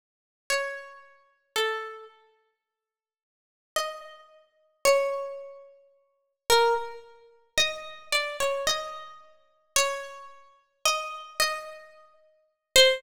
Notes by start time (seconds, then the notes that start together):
0.50 C#5
1.56 A4
3.76 D#5
4.85 C#5
6.50 A#4
7.57 D#5
8.12 D5
8.40 C#5
8.67 D#5
9.76 C#5
10.85 D#5
11.40 D#5
12.76 C5